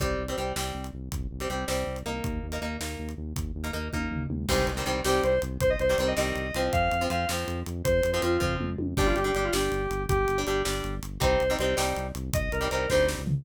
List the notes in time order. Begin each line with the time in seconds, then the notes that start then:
0.00 C2 G3 C4, kick, closed hi-hat
0.19 C2
0.28 G3 C4, closed hi-hat
0.37 C2 G3 C4
0.56 C2 G3 C4, snare
0.75 C2
0.84 closed hi-hat
0.93 C2
1.12 C2, kick, closed hi-hat
1.31 C2
1.40 G3 C4, closed hi-hat
1.49 C2 G3 C4
1.68 C2 G3 C4, snare
1.87 C2
1.96 closed hi-hat
2.06 C2 A#3 D#4
2.24 D#2, kick, closed hi-hat
2.43 D#2
2.52 A#3 D#4, closed hi-hat
2.62 D#2 A#3 D#4
2.80 D#2 A#3 D#4, snare
2.99 D#2
3.09 closed hi-hat
3.18 D#2
3.36 D#2, kick, closed hi-hat
3.55 D#2
3.64 A#3 D#4, closed hi-hat
3.73 D#2 A#3 D#4
3.93 D#2 A#3 D#4, kick, high tom
4.11 D#2, floor tom
4.30 D#2, mid tom
4.49 C2 D#3 G3 C4 C5, kick, crash
4.67 C2, closed hi-hat
4.77 D#3 G3 C4
4.86 C2 D#3 G3 C4, closed hi-hat
5.05 C2 D#3 G3 C4 G4, snare
5.23 C2 C5, closed hi-hat
5.42 C2, closed hi-hat
5.61 C2 C5, kick, closed hi-hat
5.70 D#5
5.79 C2 C5, closed hi-hat
5.89 D#3 G3 C4 C5
5.98 C2 D#3 G3 C4 C5, closed hi-hat
6.07 D#5
6.17 C2 D#3 G3 C4 D#5, snare
6.36 C2, closed hi-hat
6.54 C2 F3 C4, closed hi-hat
6.73 F2 F5, kick, closed hi-hat
6.91 F2, closed hi-hat
7.01 F3 C4
7.10 F2 F3 C4 F5, closed hi-hat
7.29 F2 F3 C4, snare
7.48 F2, closed hi-hat
7.66 F2, closed hi-hat
7.84 F2 C5, kick, closed hi-hat
8.03 F2, closed hi-hat
8.13 F3 C4 C5
8.22 F2 F3 C4 F4, closed hi-hat
8.40 F2 F3 C4, kick, floor tom
8.60 F2, mid tom
8.79 F2, high tom
8.97 G1 G3 D4 G4, kick, crash
9.06 F4
9.16 G1 G4, closed hi-hat
9.24 G3 D4 G4
9.35 G1 G3 D4 G4, closed hi-hat
9.45 F4
9.53 G1 G3 D4 G4, snare
9.72 G1, closed hi-hat
9.91 G1, closed hi-hat
10.09 G1 G4, kick, closed hi-hat
10.28 G1, closed hi-hat
10.38 G3 D4
10.47 G1 G3 D4 G4, closed hi-hat
10.65 G1 G3 D4, snare
10.84 G1, closed hi-hat
11.03 G1, closed hi-hat
11.20 C2 G3 C4 D#4 C5, kick, closed hi-hat
11.40 C2, closed hi-hat
11.50 G3 C4 D#4
11.59 C2 G3 C4 D#4 C5, closed hi-hat
11.77 C2 G3 C4 D#4, snare
11.96 C2, closed hi-hat
12.15 C2, closed hi-hat
12.33 C2 D#5, kick, closed hi-hat
12.52 C2 A#4, closed hi-hat
12.61 G3 C4 D#4
12.71 C2 G3 C4 D#4 A#4, closed hi-hat
12.90 D2 G3 C4 D#4 C5, kick, snare
13.08 snare
13.18 C#2
13.27 floor tom